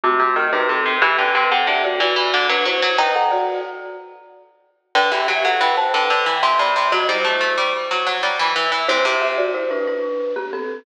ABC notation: X:1
M:6/8
L:1/16
Q:3/8=61
K:G
V:1 name="Marimba"
[A,F]3 [^DB] [CA]2 | [Ge] [Bg] [Bg] [Af] [Ge] [Fd] [Fd]3 [DB] [Ec]2 | [Bg] [Af] [Fd]2 z8 | [Bg] [Ge] [Ge] [Af] [Bg] [ca] [Bg]3 [ec'] [db]2 |
[F^d] [Ec]7 z4 | [Ec] [Ge] [Ge] [Fd] [Ec] [DB] [DB]3 [B,G] [CA]2 |]
V:2 name="Harpsichord"
C, C, ^D, C, C, C, | E, D, C, C, D, z E, E, D, F, F, F, | _E10 z2 | D, E, F, F, E, z D, D, E, C, C, C, |
F, G, A, A, G, z F, F, G, E, E, E, | C, C,7 z4 |]